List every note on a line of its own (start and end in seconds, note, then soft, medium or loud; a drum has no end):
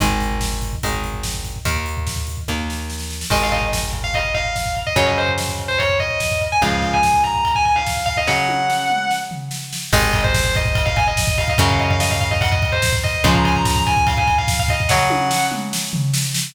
0.00 0.76 G#1 medium
0.00 0.75 D#3 medium
0.00 0.75 G#3 medium
0.00 kick loud
0.00 closed hi-hat loud
0.10 kick medium
0.20 kick medium
0.20 closed hi-hat medium
0.31 kick medium
0.41 kick medium
0.41 snare loud
0.52 kick medium
0.62 kick medium
0.62 closed hi-hat medium
0.73 kick loud
0.83 1.59 G#1 medium
0.83 1.58 D#3 medium
0.83 1.58 G#3 medium
0.83 kick loud
0.83 closed hi-hat loud
0.93 kick medium
1.03 kick medium
1.03 closed hi-hat medium
1.13 kick medium
1.23 kick medium
1.23 snare loud
1.34 kick medium
1.44 kick medium
1.44 closed hi-hat medium
1.56 kick medium
1.65 2.41 D#2 medium
1.65 2.40 D#3 medium
1.65 2.40 A#3 medium
1.65 kick loud
1.65 closed hi-hat loud
1.76 kick medium
1.86 closed hi-hat medium
1.97 kick medium
2.07 kick loud
2.07 snare loud
2.16 kick medium
2.27 kick medium
2.27 closed hi-hat medium
2.37 kick medium
2.48 3.24 D#2 medium
2.48 3.23 D#3 medium
2.48 3.23 A#3 medium
2.48 kick medium
2.48 snare medium
2.70 snare medium
2.90 snare medium
2.99 snare medium
3.10 snare medium
3.21 snare loud
3.30 4.83 G#1 medium
3.30 4.79 D#3 medium
3.30 4.79 G#3 loud
3.30 3.42 D#5 medium
3.30 kick loud
3.30 crash loud
3.40 3.52 F5 medium
3.40 kick medium
3.51 3.61 D#5 medium
3.51 kick loud
3.51 ride medium
3.62 kick medium
3.73 kick loud
3.73 snare loud
3.83 kick medium
3.93 kick loud
3.93 ride medium
4.03 4.14 F5 medium
4.03 kick medium
4.14 4.32 D#5 medium
4.14 kick loud
4.14 ride loud
4.25 kick medium
4.34 4.70 F5 medium
4.34 kick medium
4.34 ride medium
4.45 kick medium
4.56 kick medium
4.56 snare loud
4.66 kick medium
4.75 kick medium
4.75 ride medium
4.87 4.96 D#5 medium
4.87 kick medium
4.96 6.48 F#2 medium
4.96 6.45 C#3 medium
4.96 6.45 F#3 medium
4.96 5.07 C#5 medium
4.96 kick loud
4.96 ride loud
5.06 5.16 D#5 medium
5.06 kick loud
5.17 5.27 C5 medium
5.17 kick medium
5.17 ride medium
5.28 kick medium
5.38 kick medium
5.38 snare loud
5.48 kick medium
5.59 kick medium
5.59 ride medium
5.68 5.78 C5 medium
5.68 kick medium
5.78 5.95 C#5 medium
5.78 kick medium
5.78 ride loud
5.89 kick medium
5.99 6.37 D#5 medium
5.99 kick medium
5.99 ride medium
6.11 kick medium
6.20 kick medium
6.20 snare loud
6.32 kick medium
6.41 kick medium
6.41 ride medium
6.52 6.62 G#5 medium
6.52 kick medium
6.62 8.14 C#2 medium
6.62 8.11 C#3 loud
6.62 8.11 F3 loud
6.62 8.11 G#3 medium
6.62 6.92 F5 medium
6.62 kick loud
6.62 ride loud
6.72 kick medium
6.82 kick medium
6.82 ride medium
6.93 7.21 G#5 medium
6.93 kick medium
7.03 kick loud
7.03 snare loud
7.13 kick medium
7.23 7.50 A#5 medium
7.23 kick medium
7.23 ride medium
7.34 kick medium
7.45 kick medium
7.45 ride loud
7.55 7.65 G#5 medium
7.55 kick medium
7.65 7.75 G#5 medium
7.65 kick medium
7.65 ride medium
7.76 8.04 F5 medium
7.76 kick medium
7.86 kick loud
7.86 snare loud
7.96 kick medium
8.06 8.16 F5 medium
8.06 kick medium
8.06 ride medium
8.17 8.27 D#5 medium
8.17 kick medium
8.27 9.76 C#3 medium
8.27 9.76 F#3 loud
8.27 9.11 F#5 medium
8.27 kick medium
8.27 snare medium
8.49 high tom medium
8.70 snare loud
8.90 mid tom medium
9.11 snare medium
9.31 floor tom loud
9.51 snare loud
9.73 snare loud
9.93 11.45 G#1 loud
9.93 11.42 D#3 loud
9.93 11.42 G#3 loud
9.93 10.20 D#5 loud
9.93 kick loud
9.93 crash loud
10.03 kick loud
10.13 kick loud
10.13 ride loud
10.24 10.54 C5 medium
10.24 kick loud
10.34 kick loud
10.34 snare loud
10.45 kick loud
10.55 10.86 D#5 medium
10.55 kick loud
10.55 ride loud
10.65 kick loud
10.75 kick loud
10.75 ride loud
10.86 10.95 F5 medium
10.86 kick loud
10.96 11.06 G#5 medium
10.96 kick loud
10.96 ride loud
11.07 11.37 D#5 loud
11.07 kick loud
11.17 kick loud
11.17 snare loud
11.27 kick loud
11.38 11.48 F5 medium
11.38 kick loud
11.38 ride loud
11.48 11.59 D#5 medium
11.48 kick loud
11.58 13.11 F#2 loud
11.58 13.08 C#3 loud
11.58 13.08 F#3 loud
11.58 11.69 F#5 loud
11.58 kick loud
11.58 ride loud
11.68 11.78 F5 loud
11.68 kick loud
11.79 11.89 D#5 medium
11.79 kick loud
11.79 ride loud
11.90 12.00 F5 medium
11.90 kick loud
12.00 12.10 D#5 medium
12.00 kick medium
12.00 snare loud
12.10 12.20 F5 medium
12.10 kick loud
12.20 12.30 F5 medium
12.20 kick loud
12.20 ride loud
12.31 12.41 D#5 medium
12.31 kick loud
12.41 12.51 F#5 loud
12.41 kick loud
12.41 ride loud
12.51 12.71 D#5 loud
12.51 kick loud
12.62 kick loud
12.62 ride loud
12.72 12.89 C5 medium
12.72 kick loud
12.82 kick loud
12.82 snare loud
12.93 kick loud
13.04 13.21 D#5 loud
13.04 kick loud
13.04 ride loud
13.13 kick loud
13.24 14.76 C#2 loud
13.24 14.73 C#3 loud
13.24 14.73 F3 loud
13.24 14.73 G#3 loud
13.24 13.34 F5 loud
13.24 kick loud
13.24 ride loud
13.35 13.44 A#5 medium
13.35 kick loud
13.44 13.54 G#5 medium
13.44 kick loud
13.44 ride loud
13.56 13.64 A#5 medium
13.56 kick loud
13.65 13.75 A#5 medium
13.65 kick loud
13.65 snare loud
13.76 13.86 A#5 medium
13.76 kick loud
13.86 13.96 G#5 medium
13.86 kick loud
13.86 ride loud
13.96 14.06 G#5 medium
13.96 kick loud
14.07 14.17 F5 medium
14.07 kick loud
14.07 ride loud
14.17 14.36 G#5 medium
14.17 kick loud
14.27 kick loud
14.27 ride loud
14.38 14.58 F5 loud
14.38 kick loud
14.48 kick loud
14.48 snare loud
14.59 14.69 F5 medium
14.59 kick loud
14.68 14.89 D#5 medium
14.68 kick loud
14.68 ride loud
14.80 kick loud
14.89 16.39 C#3 loud
14.89 16.39 F#3 loud
14.89 15.40 F#5 medium
14.89 kick loud
14.89 snare loud
15.10 high tom loud
15.31 snare loud
15.51 mid tom loud
15.73 snare loud
15.93 floor tom loud
16.14 snare loud
16.34 snare loud